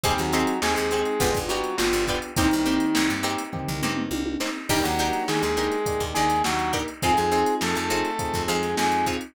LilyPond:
<<
  \new Staff \with { instrumentName = "Lead 2 (sawtooth)" } { \time 4/4 \key ees \mixolydian \tempo 4 = 103 <g g'>16 <ges ges'>8. <aes aes'>16 <aes aes'>4~ <aes aes'>16 <ges ges'>8 <f f'>8 r8 | <ees ees'>4. r2 r8 | <g g'>16 <ges ges'>8. <aes aes'>16 <aes aes'>4~ <aes aes'>16 <aes aes'>8 <ges ges'>8 r8 | <aes aes'>16 <aes aes'>8. <a a'>16 <a a'>4~ <a a'>16 <aes aes'>8 <aes aes'>8 r8 | }
  \new Staff \with { instrumentName = "Pizzicato Strings" } { \time 4/4 \key ees \mixolydian <c' ees' g' aes'>8 <c' ees' g' aes'>4 <c' ees' g' aes'>8 <b d' f' g'>8 <b d' f' g'>4 <b d' f' g'>8 | <bes c' ees' g'>8 <bes c' ees' g'>4 <bes c' ees' g'>4 <bes c' ees' g'>4 <bes c' ees' g'>8 | <d' ees' g' bes'>8 <d' ees' g' bes'>4 <d' ees' g' bes'>4 <d' ees' g' bes'>4 <d' ees' g' bes'>8 | <c' ees' f' aes'>8 <c' ees' f' aes'>4 <c' ees' f' aes'>4 <c' ees' f' aes'>4 <c' ees' f' aes'>8 | }
  \new Staff \with { instrumentName = "Electric Piano 1" } { \time 4/4 \key ees \mixolydian <c' ees' g' aes'>4 <c' ees' g' aes'>4 <b d' f' g'>4 <b d' f' g'>4 | <bes c' ees' g'>2 <bes c' ees' g'>2 | <bes d' ees' g'>2 <bes d' ees' g'>2 | <c' ees' f' aes'>2 <c' ees' f' aes'>2 | }
  \new Staff \with { instrumentName = "Electric Bass (finger)" } { \clef bass \time 4/4 \key ees \mixolydian ees,16 ees,8. ees,16 ees,8. g,,16 g,,8. g,,16 g,,8. | c,16 c,8. c,16 g,4 c,16 g,8 c,4 | ees,16 ees,8. ees16 ees,4 ees,16 ees,8 ees,4 | f,16 f,8. f,16 f,4 f,16 f,8 f,4 | }
  \new DrumStaff \with { instrumentName = "Drums" } \drummode { \time 4/4 <hh bd>16 hh16 hh16 hh16 sn16 hh16 hh16 hh16 <hh bd>16 <hh bd>16 hh16 hh16 sn16 hh16 <hh bd>16 hh16 | <hh bd>16 hh16 <hh sn>16 hh16 sn16 hh16 hh16 hh16 <bd tomfh>16 tomfh16 toml16 toml16 tommh16 tommh16 sn8 | <cymc bd>16 hh16 hh16 hh16 sn16 hh16 hh16 hh16 <hh bd>16 <hh bd>16 hh16 <hh sn>16 sn16 hh16 <hh bd>16 hh16 | <hh bd>16 <hh sn>16 hh16 hh16 sn16 hh16 hh16 hh16 <hh bd>16 <hh bd sn>16 hh16 <hh sn>16 sn16 hh16 <hh bd>16 hh16 | }
>>